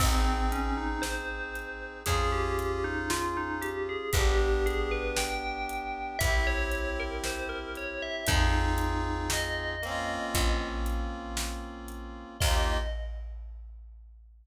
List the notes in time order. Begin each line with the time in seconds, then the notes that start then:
0.00 G#1 C4 D#4, kick, crash
0.05 G#4
0.25 C4
0.52 C#4, closed hi-hat
0.77 D#4
1.02 C5, snare
1.55 closed hi-hat
2.06 F2 C#4 F4 G#4, kick, closed hi-hat
2.12 G#4
2.32 G4
2.59 closed hi-hat
2.84 D#4
3.10 F4, snare
3.37 D#4
3.62 G4, closed hi-hat
3.89 G#4
4.13 G1 B3 G4, kick, closed hi-hat
4.17 D4 G4
4.38 G4
4.66 G#4, closed hi-hat
4.91 B4
5.17 G5, snare
5.69 closed hi-hat
6.19 C2 C4 E5, kick, closed hi-hat
6.25 E4 G4
6.47 C#5
6.72 closed hi-hat
7.00 A#4
7.24 C5, snare
7.49 A#4
7.75 C#5, closed hi-hat
8.02 E5
8.27 F2 C4 D#4, kick, closed hi-hat
8.33 F4 G#4
8.78 closed hi-hat
9.30 D#5, snare
9.82 A#3 C4, closed hi-hat
9.88 C#4 F4
10.34 A#1, kick, closed hi-hat
10.86 closed hi-hat
11.37 snare
11.88 closed hi-hat
12.40 D#2 A#3 D#4 D#5, kick, crash
12.47 F4 G4